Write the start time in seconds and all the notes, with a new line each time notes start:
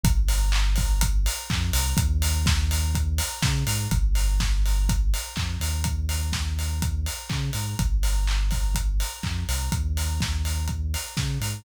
0.04 G1, kick, closed hi-hat
0.29 open hi-hat
0.52 clap
0.76 kick, open hi-hat
1.01 kick, closed hi-hat
1.26 open hi-hat
1.50 F2, kick, clap
1.73 C2, open hi-hat
1.97 D#2, kick, closed hi-hat
2.22 open hi-hat
2.46 kick, snare
2.71 open hi-hat
2.95 kick, closed hi-hat
3.18 open hi-hat
3.42 C#3, kick, snare
3.67 G#2, open hi-hat
3.91 G1, kick, closed hi-hat
4.15 open hi-hat
4.40 kick, snare
4.66 open hi-hat
4.89 kick, closed hi-hat
5.14 open hi-hat
5.36 F2, kick, clap
5.60 D#2, open hi-hat
5.84 kick, closed hi-hat
6.09 open hi-hat
6.33 kick, snare
6.59 open hi-hat
6.82 kick, closed hi-hat
7.06 open hi-hat
7.29 C#3, kick, clap
7.53 G#2, open hi-hat
7.79 G1, kick, closed hi-hat
8.03 open hi-hat
8.27 clap
8.51 kick, open hi-hat
8.75 kick, closed hi-hat
9.00 open hi-hat
9.23 F2, kick, clap
9.49 C2, open hi-hat
9.72 D#2, kick, closed hi-hat
9.97 open hi-hat
10.21 kick, snare
10.45 open hi-hat
10.68 kick, closed hi-hat
10.94 open hi-hat
11.17 C#3, kick, snare
11.41 G#2, open hi-hat